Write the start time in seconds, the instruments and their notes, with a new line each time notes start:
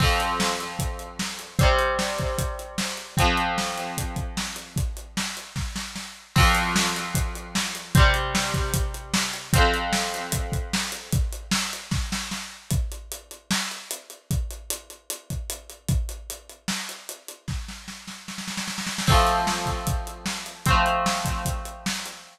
0.00 overdriven guitar F2 F3 C4, kick, crash
0.20 closed hi-hat
0.40 snare
0.60 closed hi-hat
0.79 kick, closed hi-hat
0.99 closed hi-hat
1.19 snare
1.39 closed hi-hat
1.59 overdriven guitar G3 C4, kick, closed hi-hat
1.63 overdriven guitar C3
1.79 closed hi-hat
1.99 snare
2.18 kick, closed hi-hat
2.38 kick, closed hi-hat
2.59 closed hi-hat
2.78 snare
2.97 closed hi-hat
3.17 overdriven guitar F3 C4, kick, closed hi-hat
3.21 overdriven guitar F2
3.37 closed hi-hat
3.58 snare
3.78 closed hi-hat
3.98 kick, closed hi-hat
4.16 kick, closed hi-hat
4.37 snare
4.56 closed hi-hat
4.76 kick, closed hi-hat
4.97 closed hi-hat
5.17 snare
5.37 closed hi-hat
5.56 kick, snare
5.76 snare
5.96 snare
6.36 overdriven guitar F2 F3 C4, kick, crash
6.55 closed hi-hat
6.76 snare
6.96 closed hi-hat
7.15 kick, closed hi-hat
7.35 closed hi-hat
7.55 snare
7.75 closed hi-hat
7.95 overdriven guitar G3 C4, kick, closed hi-hat
7.99 overdriven guitar C3
8.14 closed hi-hat
8.35 snare
8.54 kick, closed hi-hat
8.74 kick, closed hi-hat
8.94 closed hi-hat
9.14 snare
9.34 closed hi-hat
9.53 overdriven guitar F3 C4, kick, closed hi-hat
9.57 overdriven guitar F2
9.74 closed hi-hat
9.93 snare
10.14 closed hi-hat
10.32 kick, closed hi-hat
10.52 kick, closed hi-hat
10.73 snare
10.92 closed hi-hat
11.13 kick, closed hi-hat
11.33 closed hi-hat
11.51 snare
11.73 closed hi-hat
11.91 kick, snare
12.12 snare
12.31 snare
12.71 kick, closed hi-hat
12.92 closed hi-hat
13.12 closed hi-hat
13.31 closed hi-hat
13.51 snare
13.71 closed hi-hat
13.91 closed hi-hat
14.10 closed hi-hat
14.31 kick, closed hi-hat
14.51 closed hi-hat
14.70 closed hi-hat
14.90 closed hi-hat
15.10 closed hi-hat
15.30 kick, closed hi-hat
15.50 closed hi-hat
15.70 closed hi-hat
15.88 kick, closed hi-hat
16.09 closed hi-hat
16.30 closed hi-hat
16.49 closed hi-hat
16.68 snare
16.89 closed hi-hat
17.09 closed hi-hat
17.28 closed hi-hat
17.48 kick, snare
17.68 snare
17.88 snare
18.08 snare
18.28 snare
18.38 snare
18.48 snare
18.57 snare
18.68 snare
18.78 snare
18.87 snare
18.98 snare
19.07 overdriven guitar A3 C4, kick, crash
19.12 overdriven guitar F3
19.27 closed hi-hat
19.47 snare
19.66 kick, closed hi-hat
19.87 kick, closed hi-hat
20.07 closed hi-hat
20.26 snare
20.46 closed hi-hat
20.66 overdriven guitar A3 C4, kick, closed hi-hat
20.70 overdriven guitar F3
20.86 closed hi-hat
21.06 snare
21.25 kick, closed hi-hat
21.45 kick, closed hi-hat
21.65 closed hi-hat
21.86 snare
22.06 closed hi-hat